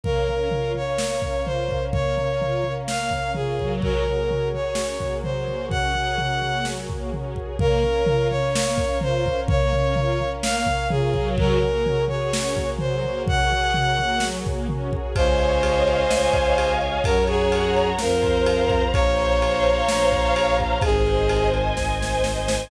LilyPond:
<<
  \new Staff \with { instrumentName = "Violin" } { \time 4/4 \key des \major \tempo 4 = 127 bes'4. des''4. c''4 | des''2 f''4 aes'4 | bes'4. des''4. c''4 | ges''2~ ges''8 r4. |
bes'4. des''4. c''4 | des''2 f''4 aes'4 | bes'4. des''4. c''4 | ges''2~ ges''8 r4. |
c''1 | bes'8 aes'4. bes'2 | des''1 | aes'4. r2 r8 | }
  \new Staff \with { instrumentName = "String Ensemble 1" } { \time 4/4 \key des \major bes8 des'8 f'8 des'8 bes8 des'8 f'8 des'8 | bes8 des'8 f'8 des'8 bes8 des'8 f'8 ges8~ | ges8 bes8 des'8 aes'8 des'8 bes8 ges8 bes8 | des'8 aes'8 des'8 bes8 ges8 bes8 des'8 aes'8 |
bes8 des'8 f'8 des'8 bes8 des'8 f'8 des'8 | bes8 des'8 f'8 des'8 bes8 des'8 f'8 ges8~ | ges8 bes8 des'8 aes'8 des'8 bes8 ges8 bes8 | des'8 aes'8 des'8 bes8 ges8 bes8 des'8 aes'8 |
des''8 ees''8 f''8 aes''8 f''8 ees''8 des''8 ees''8 | des''8 ges''8 bes''8 ges''8 c''8 f''8 bes''8 f''8 | c''8 des''8 f''8 bes''8 f''8 des''8 c''8 des''8 | c''8 ees''8 aes''8 ees''8 c''8 ees''8 aes''8 ees''8 | }
  \new Staff \with { instrumentName = "Violin" } { \clef bass \time 4/4 \key des \major r1 | r1 | r1 | r1 |
r1 | r1 | r1 | r1 |
des,2 des,2 | ges,2 f,2 | bes,,2 bes,,2 | aes,,2 aes,,2 | }
  \new Staff \with { instrumentName = "Brass Section" } { \time 4/4 \key des \major <bes' des'' f''>1~ | <bes' des'' f''>1 | <ges' aes' bes' des''>1~ | <ges' aes' bes' des''>1 |
<bes' des'' f''>1~ | <bes' des'' f''>1 | <ges' aes' bes' des''>1~ | <ges' aes' bes' des''>1 |
<des'' ees'' f'' aes''>1 | <des'' ges'' bes''>2 <c'' f'' bes''>2 | <c'' des'' f'' bes''>1 | <c'' ees'' aes''>1 | }
  \new DrumStaff \with { instrumentName = "Drums" } \drummode { \time 4/4 <bd tomfh>8 tomfh8 tomfh8 tomfh8 sn8 <bd tomfh>8 tomfh8 <bd tomfh>8 | <bd tomfh>8 tomfh8 tomfh8 tomfh8 sn8 <bd tomfh>8 tomfh8 <bd tomfh>8 | <bd tomfh>8 tomfh8 tomfh8 tomfh8 sn8 <bd tomfh>8 tomfh8 tomfh8 | <bd tomfh>8 tomfh8 tomfh8 tomfh8 sn8 <bd tomfh>8 tomfh8 <bd tomfh>8 |
<bd tomfh>8 tomfh8 tomfh8 tomfh8 sn8 <bd tomfh>8 tomfh8 <bd tomfh>8 | <bd tomfh>8 tomfh8 tomfh8 tomfh8 sn8 <bd tomfh>8 tomfh8 <bd tomfh>8 | <bd tomfh>8 tomfh8 tomfh8 tomfh8 sn8 <bd tomfh>8 tomfh8 tomfh8 | <bd tomfh>8 tomfh8 tomfh8 tomfh8 sn8 <bd tomfh>8 tomfh8 <bd tomfh>8 |
<bd cymr>8 cymr8 cymr8 cymr8 sn8 <bd cymr>8 cymr8 cymr8 | <bd cymr>8 cymr8 cymr8 cymr8 sn8 <bd cymr>8 cymr8 <bd cymr>8 | <bd cymr>8 cymr8 cymr8 cymr8 sn8 <bd cymr>8 cymr8 <bd cymr>8 | <bd cymr>8 cymr8 cymr8 cymr8 <bd sn>8 sn8 sn8 sn8 | }
>>